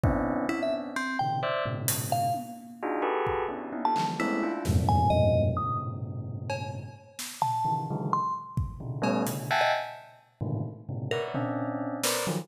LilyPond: <<
  \new Staff \with { instrumentName = "Tubular Bells" } { \time 3/4 \tempo 4 = 130 <b c' des' d' e'>4 <b c' des' d'>4 r8 <bes, c des ees>8 | <c'' d'' e''>8 <aes, bes, b, des>4. r4 | <d' ees' f' ges' aes'>8 <ges' g' aes' a' b'>4 <b des' d' e' ges' g'>8 <des' d' ees' e'>16 <ees' f' g' a'>16 <d e f g>8 | <aes a b c' des'>8 <d' e' f'>8 <e, f, g, aes, bes, c>4 <f, g, aes, bes, b,>4 |
<g, a, bes, b, des>2. | r4. <des ees e>8 <des d ees e ges aes>8 r8 | r4 <c des d>8 <g a b des'>8 <b, des d>8 <e'' ges'' g'' aes'' a''>8 | r4. <aes, a, bes, c d ees>8 r8 <aes, bes, b, c des>8 |
<bes' b' des'' d'' e'' ges''>8 <c' des' d'>4. <bes' b' c'' d''>8 <ees f ges>8 | }
  \new Staff \with { instrumentName = "Electric Piano 2" } { \time 3/4 r4 e'16 e''16 r8 c'8 g''8 | r4. f''8 r4 | r2 r16 a''8 r16 | e'8. r8. aes''8 ees''8. r16 |
ees'''8 r2 r8 | r4 a''8. r8. c'''8 | r2 r8. ees''16 | r2. |
bes'16 r2 r8. | }
  \new DrumStaff \with { instrumentName = "Drums" } \drummode { \time 3/4 bd4 r4 r4 | r4 hh4 tommh4 | r4 bd4 tommh8 hc8 | r4 sn4 r4 |
r4 r4 cb4 | r8 sn8 tomfh4 r4 | r8 bd8 tomfh8 cb8 hh4 | r4 r4 r4 |
r8 tomfh8 r4 sn4 | }
>>